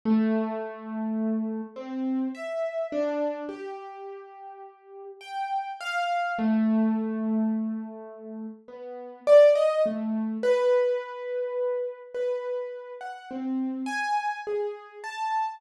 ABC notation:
X:1
M:9/8
L:1/16
Q:3/8=35
K:none
V:1 name="Acoustic Grand Piano"
A,6 C2 e2 D2 G6 | g2 f2 A,8 B,2 d ^d A,2 | B6 B3 ^f C2 ^g2 ^G2 a2 |]